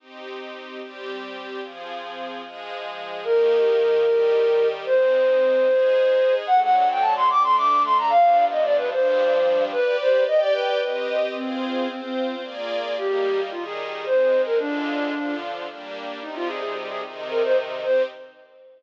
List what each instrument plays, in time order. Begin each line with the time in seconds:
0.00 string ensemble 1 C4 D#4 G4
0.81 string ensemble 1 G3 C4 G4
1.62 string ensemble 1 F3 C4 G#4
2.44 string ensemble 1 F3 G#3 G#4
3.24 string ensemble 1 D#3 A#3 G4, flute A#4
4.04 string ensemble 1 D#3 G3 G4
4.86 string ensemble 1 G#3 C4 D#4, flute C5
5.67 string ensemble 1 G#3 D#4 G#4
6.47 string ensemble 1 D3 F#3 A3, flute F#5
6.63 flute F#5
6.76 flute F#5
6.91 flute G5
7.01 flute A5
7.16 flute C6
7.30 string ensemble 1 D3 A3 D4, flute D6
7.43 flute C6
7.57 flute D6
7.85 flute C6
7.98 flute A#5
8.10 string ensemble 1 G2 F3 B3 D4, flute F5
8.51 flute D#5
8.64 flute D5
8.77 flute B4
8.91 string ensemble 1 G2 F3 G3 D4, flute C5
9.72 string ensemble 1 G4 B4 D5, flute B4
10.01 flute C5
10.27 string ensemble 1 G4 D5 G5, flute D#5
10.40 flute D5
10.53 flute B4
10.81 string ensemble 1 C4 G4 D#5
11.35 flute C4, string ensemble 1 F4 G#4 C5
11.88 flute C4, string ensemble 1 C4 F4 C5
12.02 flute C4
12.42 string ensemble 1 A#3 F4 G#4 D5
12.97 string ensemble 1 G3 A#3 D#4, flute G4
13.51 string ensemble 1 D#3 G3 D#4, flute F4
13.65 flute G#4
14.06 string ensemble 1 G#3 C4 D#4, flute C5
14.46 flute A#4
14.58 string ensemble 1 D3 G#3 F4, flute D4
15.13 string ensemble 1 D3 F3 F4
15.68 string ensemble 1 G3 A#3 D4
16.22 string ensemble 1 C3 G3 D#4, flute D#4
16.36 flute F4
16.48 flute G#4
16.62 flute G#4
16.88 flute G#4
17.03 string ensemble 1 C3 D#3 D#4
17.30 flute A#4
17.44 flute C5
17.83 string ensemble 1 C4 D#4 G4, flute C5